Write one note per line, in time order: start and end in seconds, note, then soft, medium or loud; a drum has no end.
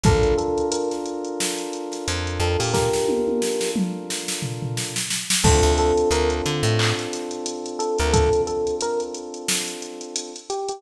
0.04 0.34 A#1 medium
0.04 4.92 D4 loud
0.04 4.92 F4 loud
0.04 4.92 A4 loud
0.04 0.35 A4 loud
0.04 4.92 A#4 loud
0.04 kick loud
0.04 closed hi-hat medium
0.23 closed hi-hat medium
0.38 0.67 A4 medium
0.38 closed hi-hat medium
0.58 closed hi-hat medium
0.72 0.90 A#4 medium
0.72 closed hi-hat loud
0.91 snare soft
0.91 closed hi-hat medium
1.06 closed hi-hat medium
1.25 closed hi-hat medium
1.40 snare medium
1.59 closed hi-hat medium
1.73 closed hi-hat medium
1.92 snare soft
1.92 closed hi-hat medium
2.08 2.39 F2 loud
2.08 closed hi-hat loud
2.27 closed hi-hat medium
2.40 2.57 F2 medium
2.40 2.59 A4 medium
2.40 closed hi-hat medium
2.59 2.90 A#2 medium
2.59 2.73 G4 medium
2.59 open hi-hat medium
2.74 3.71 G4 medium
2.74 3.71 A#4 loud
2.74 kick medium
2.74 snare medium
2.93 snare medium
3.09 high tom medium
3.28 high tom medium
3.42 snare medium
3.61 snare medium
3.76 mid tom medium
4.10 snare medium
4.28 snare medium
4.42 floor tom medium
4.62 floor tom medium
4.77 snare medium
4.96 snare medium
5.11 snare medium
5.30 snare loud
5.43 5.62 D2 loud
5.43 10.30 C4 loud
5.43 10.30 D4 loud
5.43 10.30 F4 loud
5.43 10.30 A4 loud
5.43 5.73 A4 loud
5.43 kick loud
5.43 crash loud
5.63 5.93 D2 medium
5.63 closed hi-hat medium
5.78 6.09 A4 loud
5.78 closed hi-hat medium
5.98 closed hi-hat medium
6.11 6.42 D2 medium
6.11 6.30 A#4 loud
6.11 closed hi-hat medium
6.30 closed hi-hat medium
6.46 6.63 D3 loud
6.46 closed hi-hat medium
6.63 6.93 A2 loud
6.63 closed hi-hat medium
6.79 clap loud
6.99 snare soft
6.99 closed hi-hat medium
7.13 snare soft
7.13 closed hi-hat medium
7.31 closed hi-hat medium
7.46 closed hi-hat loud
7.66 closed hi-hat medium
7.79 7.97 A4 loud
7.79 closed hi-hat medium
7.99 8.29 D2 medium
7.99 8.13 A#4 loud
7.99 closed hi-hat medium
8.13 8.42 A4 loud
8.13 kick medium
8.13 closed hi-hat loud
8.33 closed hi-hat medium
8.47 8.75 A4 medium
8.47 closed hi-hat medium
8.67 closed hi-hat medium
8.81 9.01 A#4 loud
8.81 closed hi-hat loud
9.00 closed hi-hat medium
9.15 closed hi-hat medium
9.34 closed hi-hat medium
9.48 snare loud
9.68 closed hi-hat medium
9.82 closed hi-hat medium
10.01 closed hi-hat medium
10.16 closed hi-hat loud
10.36 closed hi-hat medium
10.50 10.68 G4 medium
10.50 closed hi-hat medium
10.69 10.82 G4 medium
10.69 closed hi-hat medium